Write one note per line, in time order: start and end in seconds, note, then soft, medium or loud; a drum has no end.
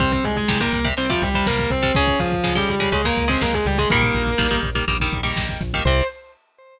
0.00 0.20 C2 medium
0.00 0.39 C3 loud
0.00 0.39 G3 loud
0.00 0.11 C4 medium
0.00 0.11 C5 medium
0.00 kick loud
0.00 closed hi-hat loud
0.12 0.23 C4 medium
0.12 0.23 C5 medium
0.12 kick loud
0.24 0.46 C2 medium
0.24 0.36 G#3 medium
0.24 0.36 G#4 medium
0.24 kick medium
0.24 closed hi-hat medium
0.36 0.59 G#3 medium
0.36 0.59 G#4 medium
0.36 kick medium
0.48 0.69 C2 medium
0.48 0.58 C3 medium
0.48 0.58 G3 loud
0.48 kick loud
0.48 snare loud
0.60 0.80 C3 medium
0.60 0.80 G3 medium
0.60 0.83 A#3 medium
0.60 0.83 A#4 medium
0.60 kick loud
0.72 0.93 C2 medium
0.72 kick loud
0.72 closed hi-hat medium
0.84 0.94 C3 loud
0.84 0.94 G3 loud
0.84 kick loud
0.97 1.18 C2 medium
0.97 1.07 C3 medium
0.97 1.07 G3 medium
0.97 1.09 C4 medium
0.97 1.09 C5 medium
0.97 closed hi-hat loud
1.10 1.29 C3 medium
1.10 1.21 F3 medium
1.10 1.29 G3 medium
1.10 1.21 F4 medium
1.10 kick loud
1.22 1.43 C2 medium
1.22 1.43 G3 medium
1.22 1.43 G4 medium
1.22 kick loud
1.22 closed hi-hat medium
1.34 1.74 C3 medium
1.34 1.74 G3 loud
1.34 kick loud
1.46 1.67 C2 medium
1.46 1.70 A#3 medium
1.46 1.70 A#4 medium
1.46 kick loud
1.46 snare loud
1.59 kick loud
1.70 1.91 C2 medium
1.70 1.93 C4 medium
1.70 1.93 C5 medium
1.70 kick loud
1.70 closed hi-hat medium
1.82 1.92 C3 loud
1.82 1.92 G3 loud
1.82 kick loud
1.95 2.16 C#2 medium
1.95 2.35 C#3 loud
1.95 2.35 G#3 loud
1.95 2.16 C#4 medium
1.95 2.16 C#5 medium
1.95 kick loud
1.95 closed hi-hat loud
2.07 kick loud
2.19 2.40 C#2 medium
2.19 2.54 F3 medium
2.19 2.54 F4 medium
2.19 kick loud
2.19 closed hi-hat medium
2.32 kick loud
2.44 2.64 C#2 medium
2.44 2.53 C#3 loud
2.44 2.53 G#3 medium
2.44 kick loud
2.44 snare loud
2.55 2.75 C#3 loud
2.55 2.68 G3 medium
2.55 2.75 G#3 medium
2.55 2.68 G4 medium
2.55 kick medium
2.68 2.89 C#2 medium
2.68 2.91 G3 medium
2.68 2.91 G4 medium
2.68 kick medium
2.68 closed hi-hat medium
2.80 2.90 C#3 loud
2.80 2.90 G#3 loud
2.80 kick medium
2.92 3.13 C#2 medium
2.92 3.02 C#3 loud
2.92 3.02 G#3 loud
2.92 3.04 G#3 medium
2.92 3.04 G#4 medium
2.92 kick medium
2.92 closed hi-hat loud
3.05 3.25 C#3 loud
3.05 3.25 G#3 loud
3.05 3.25 A#3 medium
3.05 3.25 A#4 medium
3.05 kick loud
3.17 3.38 C#2 medium
3.17 kick loud
3.17 closed hi-hat loud
3.28 3.67 C#3 medium
3.28 3.67 G#3 loud
3.28 3.41 C4 medium
3.28 3.41 C5 medium
3.28 kick medium
3.41 3.63 C#2 medium
3.41 3.53 A#3 medium
3.41 3.53 A#4 medium
3.41 kick loud
3.41 snare loud
3.53 3.65 G#3 medium
3.53 3.65 G#4 medium
3.53 kick loud
3.65 3.86 C#2 medium
3.65 3.78 G3 medium
3.65 3.78 G4 medium
3.65 kick medium
3.65 closed hi-hat medium
3.78 3.88 C#3 medium
3.78 3.90 G#3 medium
3.78 3.88 G#3 medium
3.78 3.90 G#4 medium
3.78 kick loud
3.90 4.11 A#1 medium
3.90 4.31 D#3 loud
3.90 4.31 G3 loud
3.90 4.54 A#3 medium
3.90 4.31 A#3 loud
3.90 4.54 A#4 medium
3.90 kick loud
3.90 closed hi-hat loud
4.03 kick medium
4.14 4.35 A#1 medium
4.14 kick loud
4.14 closed hi-hat medium
4.27 kick medium
4.38 4.60 A#1 medium
4.38 4.48 D#3 medium
4.38 4.48 G3 loud
4.38 4.48 A#3 loud
4.38 kick loud
4.38 snare loud
4.51 4.70 D#3 loud
4.51 4.70 G3 loud
4.51 4.70 A#3 loud
4.51 kick medium
4.63 4.84 A#1 medium
4.63 kick medium
4.63 closed hi-hat medium
4.75 4.85 D#3 medium
4.75 4.85 G3 loud
4.75 4.85 A#3 loud
4.75 kick loud
4.88 5.09 A#1 medium
4.88 4.98 D#3 medium
4.88 4.98 G3 medium
4.88 4.98 A#3 medium
4.88 kick loud
4.88 closed hi-hat loud
5.00 5.21 D#3 medium
5.00 5.21 G3 loud
5.00 5.21 A#3 medium
5.00 kick loud
5.12 5.33 A#1 medium
5.12 kick loud
5.12 closed hi-hat medium
5.23 5.62 D#3 loud
5.23 5.62 G3 medium
5.23 5.62 A#3 loud
5.23 kick medium
5.36 5.57 A#1 medium
5.36 kick loud
5.36 snare loud
5.49 kick loud
5.61 5.81 A#1 medium
5.61 kick loud
5.61 closed hi-hat medium
5.74 5.84 D#3 loud
5.74 5.84 G3 loud
5.74 5.84 A#3 medium
5.74 kick loud
5.85 6.02 C2 loud
5.85 6.04 C3 loud
5.85 6.04 G3 medium
5.85 6.02 C5 loud
5.85 kick loud
5.85 crash loud